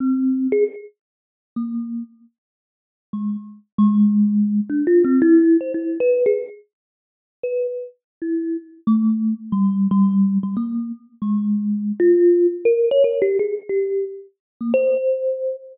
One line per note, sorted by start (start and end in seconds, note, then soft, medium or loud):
0.00 0.47 C4 medium
0.52 0.64 G#4 loud
1.56 2.03 A#3 medium
3.13 3.37 G#3 medium
3.78 4.60 G#3 loud
4.70 4.85 D4 medium
4.87 5.03 F4 loud
5.04 5.20 C4 medium
5.22 5.57 E4 loud
5.61 5.72 C5 medium
5.74 5.98 E4 medium
6.00 6.24 B4 loud
6.26 6.38 G#4 medium
7.43 7.67 B4 medium
8.22 8.57 E4 medium
8.87 9.34 A3 medium
9.52 9.87 G3 loud
9.91 10.38 G3 loud
10.43 10.55 G3 medium
10.57 10.92 A#3 medium
11.22 11.92 G#3 medium
12.00 12.47 F4 loud
12.65 12.89 A#4 loud
12.91 13.03 C#5 loud
13.04 13.20 A#4 medium
13.22 13.37 G4 medium
13.39 13.55 G#4 medium
13.69 14.05 G4 medium
14.61 14.72 A#3 medium
14.74 15.56 C5 loud